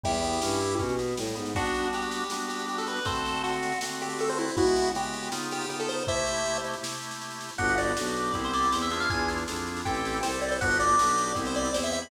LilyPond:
<<
  \new Staff \with { instrumentName = "Lead 1 (square)" } { \time 4/4 \key g \mixolydian \tempo 4 = 159 <e' g'>2 r2 | <d' fis'>4 g'4 r8 g'8 g'16 a'16 b'8 | <a' c''>4 fis'4 r8 g'8 a'16 c''16 e'8 | <e' ges'>4 g'4 r8 g'8 g'16 a'16 c''8 |
<c'' e''>4. r2 r8 | fis''8 d''4. r16 c''16 d''8 c''16 e''16 e''16 f''16 | gis''8 r4. g''4 c''8 d''16 c''16 | fis''8 d''4. r16 c''16 d''8 c''16 e''16 e''16 b''16 | }
  \new Staff \with { instrumentName = "Drawbar Organ" } { \time 4/4 \key g \mixolydian g8 b8 cis'8 e'8 cis'8 b8 g8 b8 | <g b d' fis'>2 <g b d' fis'>2 | <d a c' fis'>2 <d a c' fis'>2 | <des aes ces' ges'>4 <des aes ces' ges'>4 <des ces' ees' f'>4 <des ces' ees' f'>4 |
<c a e' g'>2 <c a e' g'>2 | <b d' fis' g'>4 <b d' fis' g'>4 <b c' e' g'>4 <b c' e' g'>8 <d' e' f' gis'>8~ | <d' e' f' gis'>4 <d' e' f' gis'>4 <c' e' g' a'>4 <c' e' g' a'>4 | <b d' fis' g'>4 <b d' fis' g'>4 <b c' e' g'>4 <b c' e' g'>4 | }
  \new Staff \with { instrumentName = "Violin" } { \clef bass \time 4/4 \key g \mixolydian e,4 g,4 b,4 a,8 gis,8 | r1 | r1 | r1 |
r1 | g,,4 b,,4 c,4 e,4 | e,4 f,4 a,,4 c,4 | g,,4 b,,4 c,4 e,4 | }
  \new DrumStaff \with { instrumentName = "Drums" } \drummode { \time 4/4 <bd sn>16 sn16 sn16 sn16 sn16 sn16 sn16 sn16 <bd sn>16 sn16 sn16 sn16 sn16 sn16 sn16 sn16 | <bd sn>16 sn16 sn16 sn16 sn16 sn16 sn16 sn16 sn16 sn16 sn16 sn16 sn16 sn16 sn16 sn16 | <bd sn>16 sn16 sn16 sn16 sn16 sn16 sn16 sn16 sn16 sn16 sn16 sn16 sn16 sn16 sn16 sn16 | <bd sn>16 sn16 sn16 sn16 sn16 sn16 sn16 sn16 sn16 sn16 sn16 sn16 sn16 sn16 sn16 sn16 |
<bd sn>16 sn16 sn16 sn16 sn16 sn16 sn16 sn16 sn16 sn16 sn16 sn16 sn16 sn16 sn16 sn16 | <bd sn>16 sn16 sn16 sn16 sn16 sn16 sn16 sn16 <bd sn>16 sn16 sn16 sn16 sn16 sn16 sn16 sn16 | <bd sn>16 sn16 sn16 sn16 sn16 sn16 sn16 sn16 <bd sn>16 sn16 sn16 sn16 sn16 sn16 sn16 sn16 | <bd sn>16 sn16 sn16 sn16 sn16 sn16 sn16 sn16 <bd sn>16 sn16 sn16 sn16 sn16 sn16 sn16 sn16 | }
>>